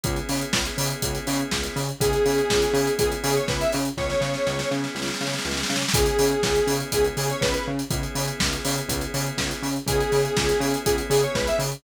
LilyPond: <<
  \new Staff \with { instrumentName = "Lead 1 (square)" } { \time 4/4 \key cis \minor \tempo 4 = 122 r1 | gis'2 gis'16 r16 gis'16 cis''16 b'16 e''16 r8 | cis''4. r2 r8 | gis'2 gis'16 r16 gis'16 cis''16 b'16 b'16 r8 |
r1 | gis'2 gis'16 r16 gis'16 cis''16 b'16 e''16 r8 | }
  \new Staff \with { instrumentName = "Drawbar Organ" } { \time 4/4 \key cis \minor <b cis' e' gis'>1 | <b cis' e' gis'>1 | <b cis' e' gis'>1 | <b cis' e' gis'>1 |
<b cis' e' gis'>1 | <b cis' e' gis'>1 | }
  \new Staff \with { instrumentName = "Synth Bass 1" } { \clef bass \time 4/4 \key cis \minor cis,8 cis8 cis,8 cis8 cis,8 cis8 cis,8 cis8 | cis,8 cis8 cis,8 cis8 cis,8 cis8 cis,8 cis8 | cis,8 cis8 cis,8 cis8 cis,8 cis8 cis,8 cis8 | cis,8 cis8 cis,8 cis8 cis,8 cis8 cis,8 cis8 |
cis,8 cis8 cis,8 cis8 cis,8 cis8 cis,8 cis8 | cis,8 cis8 cis,8 cis8 cis,8 cis8 cis,8 cis8 | }
  \new DrumStaff \with { instrumentName = "Drums" } \drummode { \time 4/4 <hh bd>16 hh16 hho16 hh16 <bd sn>16 hh16 hho16 hh16 <hh bd>16 hh16 hho16 hh16 <bd sn>16 hh16 hho16 hh16 | <hh bd>16 hh16 hho16 hh16 <bd sn>16 hh16 hho16 hh16 <hh bd>16 hh16 hho16 hh16 <bd sn>16 hh16 hho16 hh16 | <bd sn>16 sn16 sn16 sn16 sn16 sn16 sn16 sn16 sn32 sn32 sn32 sn32 sn32 sn32 sn32 sn32 sn32 sn32 sn32 sn32 sn32 sn32 sn32 sn32 | <hh bd>16 hh16 hho16 hh16 <bd sn>16 hh16 hho16 hh16 <hh bd>16 hh16 hho16 hh16 <bd sn>16 hh8 hh16 |
<hh bd>16 hh16 hho16 hh16 <bd sn>16 hh16 hho16 hh16 <hh bd>16 hh16 hho16 hh16 <bd sn>16 hh16 hho16 hh16 | <hh bd>16 hh16 hho16 hh16 <bd sn>16 hh16 hho16 hh16 <hh bd>16 hh16 hho16 hh16 <bd sn>16 hh16 hho16 hh16 | }
>>